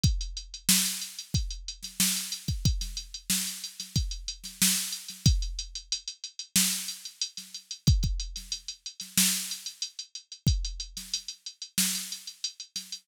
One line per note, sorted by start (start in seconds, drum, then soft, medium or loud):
0.04 kick loud
0.04 closed hi-hat loud
0.21 closed hi-hat medium
0.37 closed hi-hat medium
0.54 closed hi-hat medium
0.69 snare loud
0.86 closed hi-hat medium
1.02 closed hi-hat medium
1.19 closed hi-hat medium
1.34 kick loud
1.34 closed hi-hat loud
1.51 closed hi-hat medium
1.68 closed hi-hat medium
1.83 snare soft
1.83 closed hi-hat medium
2.00 snare loud
2.17 closed hi-hat medium
2.32 closed hi-hat loud
2.48 kick medium
2.48 closed hi-hat medium
2.65 kick loud
2.65 closed hi-hat loud
2.81 snare soft
2.81 closed hi-hat medium
2.97 closed hi-hat medium
3.14 closed hi-hat medium
3.30 snare loud
3.47 closed hi-hat medium
3.64 closed hi-hat medium
3.80 snare soft
3.80 closed hi-hat medium
3.96 kick loud
3.96 closed hi-hat loud
4.11 closed hi-hat medium
4.28 closed hi-hat loud
4.44 snare soft
4.44 closed hi-hat medium
4.62 snare loud
4.76 snare soft
4.76 closed hi-hat medium
4.92 closed hi-hat medium
5.09 snare soft
5.09 closed hi-hat medium
5.26 kick loud
5.26 closed hi-hat loud
5.42 closed hi-hat medium
5.59 closed hi-hat loud
5.75 closed hi-hat medium
5.92 closed hi-hat loud
6.08 closed hi-hat medium
6.24 closed hi-hat medium
6.39 closed hi-hat medium
6.56 snare loud
6.72 closed hi-hat medium
6.88 closed hi-hat medium
7.05 closed hi-hat medium
7.21 closed hi-hat loud
7.37 snare soft
7.37 closed hi-hat medium
7.54 closed hi-hat medium
7.71 closed hi-hat medium
7.87 kick loud
7.87 closed hi-hat loud
8.03 kick medium
8.03 closed hi-hat medium
8.20 closed hi-hat medium
8.36 snare soft
8.36 closed hi-hat medium
8.52 closed hi-hat loud
8.68 closed hi-hat medium
8.86 closed hi-hat medium
9.00 snare soft
9.00 closed hi-hat medium
9.18 snare loud
9.34 closed hi-hat medium
9.51 closed hi-hat medium
9.66 closed hi-hat medium
9.82 closed hi-hat loud
9.99 closed hi-hat medium
10.15 closed hi-hat medium
10.32 closed hi-hat medium
10.47 kick loud
10.47 closed hi-hat loud
10.65 closed hi-hat medium
10.80 closed hi-hat medium
10.97 snare medium
10.97 closed hi-hat medium
11.14 closed hi-hat loud
11.28 closed hi-hat medium
11.46 closed hi-hat medium
11.62 closed hi-hat medium
11.78 snare loud
11.94 snare soft
11.94 closed hi-hat medium
12.12 closed hi-hat medium
12.27 closed hi-hat medium
12.44 closed hi-hat loud
12.60 closed hi-hat medium
12.76 snare soft
12.76 closed hi-hat loud
12.92 closed hi-hat medium